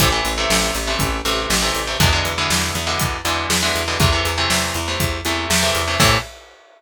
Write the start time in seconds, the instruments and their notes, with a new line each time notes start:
0.00 electric bass (finger) A1, overdriven guitar C3 E3 A3, kick, closed hi-hat
0.12 overdriven guitar C3 E3 A3
0.25 electric bass (finger) A1, closed hi-hat
0.38 overdriven guitar C3 E3 A3
0.50 electric bass (finger) A1, snare
0.75 electric bass (finger) A1, closed hi-hat
0.87 overdriven guitar C3 E3 A3
0.99 electric bass (finger) A1, kick, closed hi-hat
1.25 electric bass (finger) A1, overdriven guitar C3 E3 A3, closed hi-hat
1.50 electric bass (finger) A1, snare
1.62 overdriven guitar C3 E3 A3
1.75 electric bass (finger) A1, closed hi-hat
1.87 overdriven guitar C3 E3 A3
2.00 electric bass (finger) E2, overdriven guitar B2 D3 E3 G#3, kick, closed hi-hat
2.12 overdriven guitar B2 D3 E3 G#3
2.25 electric bass (finger) E2, closed hi-hat
2.38 overdriven guitar B2 D3 E3 G#3
2.50 electric bass (finger) E2, snare
2.75 electric bass (finger) E2, closed hi-hat
2.87 overdriven guitar B2 D3 E3 G#3
2.99 electric bass (finger) E2, kick, closed hi-hat
3.25 electric bass (finger) E2, overdriven guitar B2 D3 E3 G#3, closed hi-hat
3.50 electric bass (finger) E2, snare
3.63 overdriven guitar B2 D3 E3 G#3
3.75 electric bass (finger) E2, closed hi-hat
3.88 overdriven guitar B2 D3 E3 G#3
4.00 electric bass (finger) E2, overdriven guitar C3 E3 A3, kick, closed hi-hat
4.12 overdriven guitar C3 E3 A3
4.25 electric bass (finger) E2, closed hi-hat
4.38 overdriven guitar C3 E3 A3
4.50 electric bass (finger) E2, snare
4.74 electric bass (finger) E2, closed hi-hat
4.88 overdriven guitar C3 E3 A3
5.00 electric bass (finger) E2, kick, closed hi-hat
5.25 electric bass (finger) E2, overdriven guitar C3 E3 A3, closed hi-hat
5.50 electric bass (finger) E2, snare
5.63 overdriven guitar C3 E3 A3
5.75 electric bass (finger) E2, closed hi-hat
5.88 overdriven guitar C3 E3 A3
6.00 electric bass (finger) A2, overdriven guitar C3 E3 A3, kick, crash